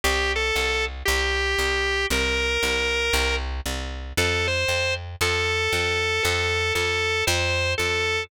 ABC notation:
X:1
M:4/4
L:1/8
Q:"Swing" 1/4=116
K:C
V:1 name="Drawbar Organ"
G A2 z G4 | _B5 z3 | A c2 z A4 | A2 A2 c2 A2 |]
V:2 name="Electric Bass (finger)" clef=bass
C,,2 C,,2 C,,2 C,,2 | C,,2 C,,2 C,,2 C,,2 | F,,2 F,,2 F,,2 F,,2 | F,,2 F,,2 F,,2 F,,2 |]